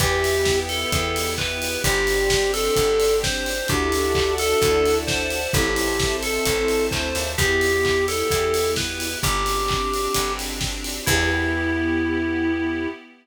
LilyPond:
<<
  \new Staff \with { instrumentName = "Electric Piano 2" } { \time 4/4 \key e \minor \tempo 4 = 130 g'4. a'4. b'4 | g'4. a'4. c''4 | g'4. a'4. c''4 | g'4. a'4. c''4 |
g'4. a'4. b'4 | g'2~ g'8 r4. | e'1 | }
  \new Staff \with { instrumentName = "Acoustic Grand Piano" } { \time 4/4 \key e \minor <b' e'' g''>1 | <c'' d'' g''>1 | <d' e' fis' a'>1 | <c' e' a'>1 |
<b e' g'>1 | r1 | <b e' g'>1 | }
  \new Staff \with { instrumentName = "Electric Bass (finger)" } { \clef bass \time 4/4 \key e \minor e,2 e,2 | g,,2 g,,2 | d,2 d,2 | a,,2 a,,4 d,8 dis,8 |
e,2 e,2 | g,,2 g,,2 | e,1 | }
  \new Staff \with { instrumentName = "Pad 5 (bowed)" } { \time 4/4 \key e \minor <b e' g'>1 | <c' d' g'>1 | <d'' e'' fis'' a''>1 | <c'' e'' a''>1 |
<b e' g'>1 | <c' d' g'>1 | <b e' g'>1 | }
  \new DrumStaff \with { instrumentName = "Drums" } \drummode { \time 4/4 <hh bd>8 hho8 <bd sn>8 hho8 <hh bd>8 hho8 <hc bd>8 hho8 | <hh bd>8 hho8 <bd sn>8 hho8 <hh bd>8 hho8 <bd sn>8 hho8 | <hh bd>8 hho8 <hc bd>8 hho8 <hh bd>8 hho8 <bd sn>8 hho8 | <hh bd>8 hho8 <bd sn>8 hho8 <hh bd>8 hho8 <hc bd>8 hho8 |
<hh bd>8 hho8 <hc bd>8 hho8 <hh bd>8 hho8 <bd sn>8 hho8 | <hh bd>8 hho8 <hc bd>8 hho8 <hh bd>8 hho8 <bd sn>8 hho8 | <cymc bd>4 r4 r4 r4 | }
>>